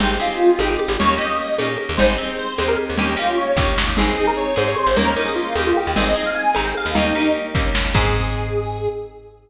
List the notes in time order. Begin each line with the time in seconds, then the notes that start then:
0.00 G#1 C4 D#4 G4 G#4, crash, low conga
0.20 C4 D#4 F4 G4 G#4
0.58 G#1 C4 D#4 G4 G#4, tambourine, high conga
0.69 G4
0.79 high conga
0.88 G#1
0.99 D#2 A#3 C#4 D#4 G4 C#5, low conga
1.18 A#3 C#4 D#4 G4 D#5
1.59 A#2 A#3 C#4 D#4 G4, tambourine, high conga
1.78 high conga
1.89 D#2
1.97 G#1 C4 D#4 G4 G#4 C5, low conga
2.18 C4 D#4 G4 G#4
2.38 C5
2.58 D#2 C4 D#4 G4 G#4 C5, tambourine, high conga
2.68 A#4
2.78 high conga
2.90 D#2
2.98 D#2 A#3 C#4 D#4 G4, low conga
3.17 A#3 C#4 D#4 F4 G4
3.37 C#5
3.57 D#2 A#3 C#4 D#4 G4, kick, snare
3.78 snare
3.88 D#2
3.97 G#1 C4 D#4 G#4, crash, low conga
4.17 C4 D#4 G#4
4.27 A#4
4.37 C#5
4.56 G#2 C4 D#4 G#4 C5, tambourine, high conga
4.68 C#5
4.76 C5, high conga
4.87 G#1
4.96 D#2 A#3 C#4 D#4 G4 A#4, low conga
5.16 A#3 C#4 D#4 G4
5.25 G#4
5.36 F4
5.55 D#2 A#3 C#4 D#4 G4, tambourine, high conga
5.67 F4
5.76 G4, high conga
5.87 D#2
5.96 G#1 C4 D#4 G#4 D#5, low conga
6.16 C4 D#4 G#4
6.26 F5
6.35 G#5
6.55 G#1 C4 D#4 G#4 A#5, tambourine, high conga
6.65 G5
6.75 F5, high conga
6.86 D#2
6.95 D#2 A#3 C#4 D#4 G4, low conga
7.15 A#3 C#4 D#4 G4
7.55 D#2 A#3 C#4 D#4 G4, kick, snare
7.75 snare
7.85 D#2
7.94 G#2 C4 D#4 G#4, kick, crash